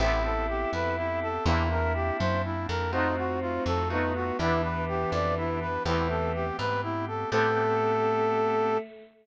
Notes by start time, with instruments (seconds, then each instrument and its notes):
0.00 electric bass (finger) A1, acoustic guitar (steel) B3 C4 G4 A4, drawbar organ B3 C4 G4 A4, choir aahs E4, brass section E4
0.24 brass section A4
0.48 brass section G4
0.73 electric bass (finger) F2, brass section B4
0.97 brass section E4
1.22 brass section A4
1.46 electric bass (finger) E2, acoustic guitar (steel) A#3 C4 D4 E4, drawbar organ A#3 C4 D4 E4, brass section E4, choir aahs E4
1.71 brass section A#4
1.95 brass section G4
2.19 electric bass (finger) F#2, brass section C5
2.44 brass section E4
2.68 electric bass (finger) F2, brass section A#4
2.92 drawbar organ A3 D#4 F4 F#4, acoustic guitar (steel) A3 D#4 F4 F#4, choir aahs C4, brass section D#4
3.17 brass section F#4
3.41 brass section F4
3.66 electric bass (finger) F2, brass section A4
3.90 acoustic guitar (steel) A3 D#4 F4 F#4, choir aahs B3, brass section D#4
4.15 brass section F#4
4.39 electric bass (finger) E2, choir aahs E3, drawbar organ B3 D4 E4 G4, acoustic guitar (steel) B3 D4 E4 G4, brass section E4
4.63 brass section B4
4.88 brass section G4
5.12 electric bass (finger) F2, brass section D5
5.37 brass section E4
5.61 brass section B4
5.85 electric bass (finger) E2, choir aahs E3, acoustic guitar (steel) A3 B3 C4 G4, drawbar organ A3 B3 C4 G4, brass section E4
6.10 brass section A4
6.34 brass section G4
6.59 electric bass (finger) G#2, brass section B4
6.83 brass section E4
7.08 brass section A4
7.31 electric bass (finger) A2, choir aahs A3, drawbar organ B3 C4 G4 A4, acoustic guitar (steel) B3 C4 G4 A4, brass section A4